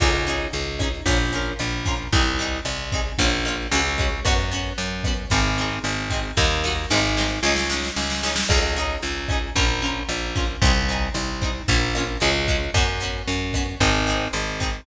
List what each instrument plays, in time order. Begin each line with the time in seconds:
0.00 electric bass (finger) C#2, acoustic guitar (steel) C#4 D#4 G#4, kick, cross-stick, crash
0.27 acoustic guitar (steel) C#4 D#4 G#4, closed hi-hat
0.53 electric bass (finger) C#2, closed hi-hat
0.79 acoustic guitar (steel) C#4 D#4 G#4, kick, cross-stick, closed hi-hat
1.06 electric bass (finger) A#1, acoustic guitar (steel) C#4 F4 A#4, kick, closed hi-hat
1.32 acoustic guitar (steel) C#4 F4 A#4, closed hi-hat
1.59 electric bass (finger) A#1, cross-stick, closed hi-hat
1.85 acoustic guitar (steel) C#4 F4 A#4, kick, snare, closed hi-hat
2.12 electric bass (finger) C2, acoustic guitar (steel) C4 D#4 G#4, kick, closed hi-hat
2.39 acoustic guitar (steel) C4 D#4 G#4, closed hi-hat
2.65 electric bass (finger) C2, cross-stick, closed hi-hat
2.92 acoustic guitar (steel) C4 D#4 G#4, kick, closed hi-hat
3.18 electric bass (finger) A#1, acoustic guitar (steel) A#3 C#4 F4, kick, closed hi-hat
3.45 acoustic guitar (steel) A#3 C#4 F4, cross-stick, closed hi-hat
3.71 electric bass (finger) C#2, acoustic guitar (steel) G#3 C#4 F#4, closed hi-hat
3.98 acoustic guitar (steel) G#3 C#4 F#4, kick, closed hi-hat
4.25 electric bass (finger) F#2, acoustic guitar (steel) B3 C#4 F#4, kick, cross-stick, closed hi-hat
4.51 acoustic guitar (steel) B3 C#4 F#4, closed hi-hat
4.78 electric bass (finger) F#2, closed hi-hat
5.03 acoustic guitar (steel) B3 C#4, kick, cross-stick, closed hi-hat
5.08 acoustic guitar (steel) F#4
5.30 electric bass (finger) G#1, acoustic guitar (steel) C4 D#4 G#4, kick, closed hi-hat
5.58 acoustic guitar (steel) C4 D#4 G#4, snare, closed hi-hat
5.84 electric bass (finger) G#1, cross-stick, closed hi-hat
6.10 acoustic guitar (steel) C4 D#4 G#4, kick, closed hi-hat
6.37 electric bass (finger) D#2, acoustic guitar (steel) A#3 D#4 F#4, kick, snare
6.64 acoustic guitar (steel) A#3 D#4 F#4, snare
6.90 electric bass (finger) G#1, acoustic guitar (steel) G#3 C4 D#4, snare
7.17 acoustic guitar (steel) G#3 C4 D#4, snare
7.43 electric bass (finger) C#2, acoustic guitar (steel) G#3 C#4 D#4, snare
7.56 snare
7.70 acoustic guitar (steel) G#3 C#4 D#4, snare
7.84 snare
7.96 electric bass (finger) C#2, snare
8.10 snare
8.23 acoustic guitar (steel) G#3 C#4 D#4, snare
8.36 snare
8.49 electric bass (finger) C#2, acoustic guitar (steel) C#4 D#4 G#4, kick, cross-stick, crash
8.76 acoustic guitar (steel) C#4 D#4 G#4, closed hi-hat
9.02 electric bass (finger) C#2, closed hi-hat
9.29 acoustic guitar (steel) C#4 D#4 G#4, kick, cross-stick, closed hi-hat
9.56 electric bass (finger) A#1, acoustic guitar (steel) C#4 F4 A#4, kick, closed hi-hat
9.82 acoustic guitar (steel) C#4 F4 A#4, closed hi-hat
10.09 electric bass (finger) A#1, cross-stick, closed hi-hat
10.35 acoustic guitar (steel) C#4 F4 A#4, kick, snare, closed hi-hat
10.62 electric bass (finger) C2, acoustic guitar (steel) C4 D#4 G#4, kick, closed hi-hat
10.89 acoustic guitar (steel) C4 D#4 G#4, closed hi-hat
11.14 electric bass (finger) C2, cross-stick, closed hi-hat
11.41 acoustic guitar (steel) C4 D#4 G#4, kick, closed hi-hat
11.68 electric bass (finger) A#1, acoustic guitar (steel) A#3 C#4 F4, kick, closed hi-hat
11.94 acoustic guitar (steel) A#3 C#4, cross-stick, closed hi-hat
11.98 acoustic guitar (steel) F4
12.20 electric bass (finger) C#2, acoustic guitar (steel) G#3 C#4 F#4, closed hi-hat
12.48 acoustic guitar (steel) G#3 C#4 F#4, kick, closed hi-hat
12.74 electric bass (finger) F#2, acoustic guitar (steel) B3 C#4 F#4, kick, cross-stick, closed hi-hat
13.00 acoustic guitar (steel) B3 C#4 F#4, closed hi-hat
13.28 electric bass (finger) F#2, closed hi-hat
13.53 acoustic guitar (steel) B3 C#4 F#4, kick, cross-stick, closed hi-hat
13.80 electric bass (finger) G#1, acoustic guitar (steel) C4 D#4 G#4, kick, closed hi-hat
14.06 acoustic guitar (steel) C4 D#4 G#4, snare, closed hi-hat
14.33 electric bass (finger) G#1, cross-stick, closed hi-hat
14.60 acoustic guitar (steel) C4 D#4 G#4, kick, closed hi-hat